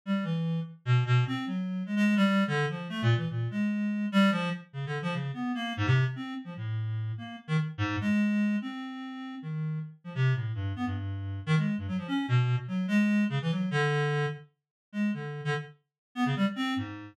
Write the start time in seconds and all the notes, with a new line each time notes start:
0.06 G3
0.23 E3
0.85 B2
1.06 B2
1.27 C4
1.46 F#3
1.86 G#3
1.96 G#3
2.16 G3
2.47 D3
2.69 F3
2.89 A3
3.02 A#2
3.16 E3
3.30 A#2
3.51 G#3
4.12 G3
4.31 F3
4.73 C#3
4.86 D3
5.02 F3
5.13 C#3
5.34 B3
5.55 A#3
5.77 G#2
5.86 C3
6.16 C4
6.44 F3
6.57 A2
7.18 A#3
7.48 D#3
7.78 G#2
8.01 G#3
8.62 C4
9.42 D#3
10.04 F3
10.15 C3
10.34 A2
10.54 G2
10.76 B3
10.85 G2
11.46 D#3
11.57 G#3
11.78 G2
11.88 F#3
11.98 F3
12.08 C#4
12.28 B2
12.68 F#3
12.88 G#3
13.30 C#3
13.42 E3
13.51 F#3
13.71 D3
14.93 G#3
15.14 D3
15.45 D3
16.15 B3
16.26 C#3
16.36 G3
16.56 C4
16.76 G#2